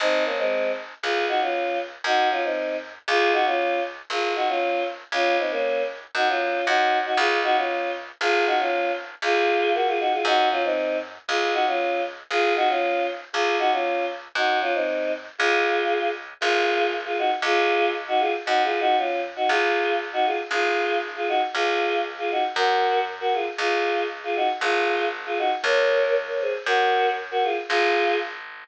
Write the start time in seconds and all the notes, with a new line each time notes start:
0.00 G#1 C4 D#4
0.25 A#3 C#4
0.38 G#3 C4
1.03 C#2 F4 G#4
1.28 D#4 F#4
1.41 C#4 F4
2.04 F#2 D#4 F#4
2.31 C#4 F4
2.44 C4 D#4
3.08 C#2 F4 G#4
3.33 D#4 F#4
3.46 C#4 F4
4.10 G#1 F4 G#4
4.36 D#4 F#4
4.49 C#4 F4
5.12 C#2 C#4 F4
5.39 C4 D#4
5.51 A#3 C#4
6.15 F#2 D#4 F#4
6.29 C#4 F4
6.67 F#2 D#4 F#4
7.05 D#4 F#4
7.17 C#2 F4 G#4
7.44 D#4 F#4
7.56 C#4 F4
8.21 G#1 F4 G#4
8.46 D#4 F#4
8.59 C#4 F4
9.22 C#2 F4 G#4
9.74 F#4 A#4
9.87 F4 G#4
10.00 D#4 F#4
10.13 F4 G#4
10.25 F#2 D#4 F#4
10.51 C#4 F4
10.64 C4 D#4
11.28 C#2 F4 G#4
11.53 D#4 F#4
11.67 C#4 F4
12.31 G#1 F4 G#4
12.56 D#4 F#4
12.69 C#4 F4
13.33 C#2 F4 G#4
13.59 D#4 F#4
13.72 C#4 F4
14.35 F#2 D#4 F#4
14.61 C#4 F4
14.74 C4 D#4
15.38 C#2 F4 G#4
16.41 G#1 F4 G#4
17.05 F4 G#4
17.18 D#4 F#4
17.42 C#2 F4 G#4
18.08 D#4 F#4
18.20 F4 G#4
18.46 F#2 D#4 F#4
18.64 F4 G#4
18.80 D#4 F#4
18.98 C#4 F4
19.36 D#4 F#4
19.49 C#2 F4 G#4
20.13 D#4 F#4
20.26 F4 G#4
20.51 G#1 F4 G#4
21.16 F4 G#4
21.28 D#4 F#4
21.54 C#2 F4 G#4
22.18 F4 G#4
22.31 D#4 F#4
22.56 F#2 F#4 A#4
23.20 F#4 A#4
23.33 F4 G#4
23.58 C#2 F4 G#4
24.24 F4 G#4
24.36 D#4 F#4
24.61 G#1 F4 G#4
25.26 F4 G#4
25.38 D#4 F#4
25.64 C#2 A#4 C#5
26.28 A#4 C#5
26.41 G#4 C5
26.66 F#2 F#4 A#4
27.31 F#4 A#4
27.43 F4 G#4
27.69 G#1 F4 G#4